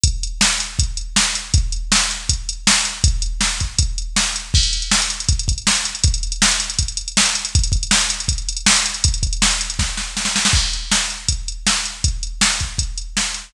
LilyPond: \new DrumStaff \drummode { \time 4/4 \tempo 4 = 160 <hh bd>8 hh8 sn8 hh8 <hh bd>8 hh8 sn8 hh8 | <hh bd>8 hh8 sn8 hh8 <hh bd>8 hh8 sn8 hh8 | <hh bd>8 hh8 sn8 <hh bd>8 <hh bd>8 hh8 sn8 hh8 | <cymc bd>16 hh16 hh16 hh16 sn16 hh16 hh16 hh16 <hh bd>16 hh16 <hh bd>16 hh16 sn16 hh16 hh16 hh16 |
<hh bd>16 hh16 hh16 hh16 sn16 hh16 hh16 hh16 <hh bd>16 hh16 hh16 hh16 sn16 hh16 hh16 hh16 | <hh bd>16 hh16 <hh bd>16 hh16 sn16 hh16 hh16 hh16 <hh bd>16 hh16 hh16 hh16 sn16 hh16 hh16 hh16 | <hh bd>16 hh16 <hh bd>16 hh16 sn16 hh16 hh16 hh16 <bd sn>8 sn8 sn16 sn16 sn16 sn16 | <cymc bd>8 hh8 sn8 hh8 <hh bd>8 hh8 sn8 hh8 |
<hh bd>8 hh8 sn8 <hh bd>8 <hh bd>8 hh8 sn8 hh8 | }